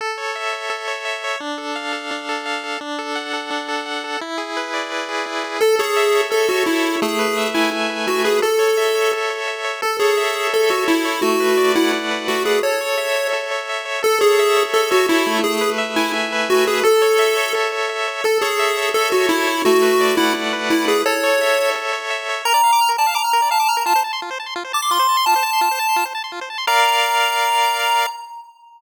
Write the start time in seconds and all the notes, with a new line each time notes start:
0.01 A4
0.18 C#5
0.35 E5
0.53 C#5
0.70 A4
0.88 C#5
1.05 E5
1.24 C#5
1.40 D4
1.58 A4
1.76 F5
1.93 A4
2.11 D4
2.29 A4
2.46 F5
2.64 A4
2.81 D4
2.99 A4
3.15 F#5
3.33 A4
3.50 D4
3.68 A4
3.86 F#5
4.04 A4
4.21 E4
4.38 G#4
4.57 B4
4.74 D5
4.92 B4
5.09 G#4
5.26 E4
5.44 G#4
5.61 A4
5.79 G#4 C#5
5.97 E5
6.15 C#5
6.30 A4
6.49 F#4 C#5
6.66 E4 E5
6.84 C#5
7.02 A3 G#4
7.19 B4
7.37 E5
7.54 E4 G#5
7.71 E5
7.90 B4
8.07 A3 F#4
8.24 G#4 B4
8.42 A4
8.59 C#5
8.77 E5
8.95 C#5
9.13 A4
9.30 C#5
9.48 E5
9.64 C#5
9.82 A4
9.99 G#4 C#5
10.17 E5
10.35 C#5
10.53 A4
10.70 F#4 C#5
10.88 E4 E5
11.05 C#5
11.22 A3 F#4
11.40 B4
11.57 D5
11.75 E4 F#5
11.93 D5
12.11 B4
12.28 A3 F#4
12.45 G#4 B4
12.63 A4 C#5
12.81 C#5
12.98 E5
13.16 C#5
13.33 A4
13.51 C#5
13.69 E5
13.85 C#5
14.03 A4
14.21 G#4 C#5
14.39 E5
14.56 C#5
14.74 A4
14.91 F#4 C#5
15.08 E4 E5
15.26 A3
15.44 G#4
15.61 B4
15.78 E5
15.96 E4 G#5
16.13 E5
16.32 B4
16.49 A3 F#4
16.67 G#4 B4
16.83 A4
17.02 C#5
17.19 E5
17.37 C#5
17.55 A4
17.72 C#5
17.89 E5
18.08 C#5
18.24 A4
18.41 G#4 C#5
18.59 E5
18.77 C#5
18.94 A4
19.12 F#4 C#5
19.29 E4 E5
19.47 C#5
19.65 A3 F#4
19.82 B4
20.00 D5
20.17 E4 F#5
20.34 D5
20.53 B4
20.70 A3 E4
20.88 G#4 B4
21.06 A4 C#5
21.23 C#5
21.41 E5
21.58 C#5
21.75 A4
21.93 C#5
22.10 E5
22.29 C#5
22.45 A#4 A#5
22.54 D5
22.64 F5
22.73 D6
22.81 F6
22.89 A#4
22.98 D5 A5
23.07 F5
23.15 A#5 D6
23.24 F6
23.33 A#4
23.42 D5
23.51 F5 A5
23.60 D6
23.68 A#5 F6
23.77 A#4
23.86 F4 A5
23.96 C5
24.04 A5
24.13 C6
24.22 F4
24.31 C5
24.40 A5
24.46 C6
24.56 F4
24.65 C5
24.73 A5 D6
24.82 C6
24.91 F4 C6
24.99 C5
25.09 A5
25.17 C6
25.26 F4 A5
25.36 C5
25.43 A5
25.53 C6
25.61 F4
25.71 C5
25.79 A5
25.89 C6
25.96 F4
26.05 C5
26.15 A5
26.24 C6
26.32 F4
26.41 C5
26.50 A5
26.58 C6
26.67 A#4 D5 F5 A#5